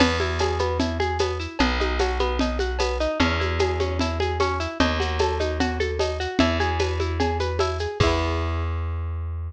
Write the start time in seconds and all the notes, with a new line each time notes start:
0.00 E2 B3, crash, cowbell, low conga, shaker
0.20 E4, high conga, shaker
0.39 G#4, tambourine, cowbell, high conga, shaker
0.59 B3, high conga, shaker
0.80 E4, cowbell, low conga, shaker
1.00 G#4, high conga, shaker
1.19 B3, tambourine, cowbell, high conga, shaker
1.40 E4, shaker
1.59 B1 B3, cowbell, low conga, shaker
1.80 D#4, high conga, shaker
1.99 F#4, tambourine, cowbell, high conga, shaker
2.19 B3, high conga, shaker
2.39 D#4, cowbell, low conga, shaker
2.59 F#4, high conga, shaker
2.79 B3, tambourine, cowbell, high conga, shaker
3.00 D#4, shaker
3.20 E2 C#4, cowbell, low conga, shaker
3.40 E4, high conga, shaker
3.59 G#4, tambourine, cowbell, high conga, shaker
3.80 C#4, high conga, shaker
3.99 E4, cowbell, low conga, shaker
4.20 G#4, high conga, shaker
4.40 C#4, tambourine, cowbell, high conga, shaker
4.60 E4, shaker
4.80 D#2 D#4, cowbell, low conga, shaker
5.00 F#4, high conga, shaker
5.19 A4, tambourine, cowbell, high conga, shaker
5.40 D#4, high conga, shaker
5.60 F#4, cowbell, low conga, shaker
5.80 A4, high conga, shaker
5.99 D#4, tambourine, cowbell, high conga, shaker
6.20 F#4, shaker
6.39 E2 E4, cowbell, low conga, shaker
6.60 G#4, high conga, shaker
6.80 B4, tambourine, cowbell, high conga, shaker
7.00 E4, high conga, shaker
7.20 G#4, cowbell, low conga, shaker
7.40 B4, high conga, shaker
7.59 E4, tambourine, cowbell, high conga, shaker
7.79 G#4, shaker
8.00 E2 E4 G#4, kick, crash
8.07 B3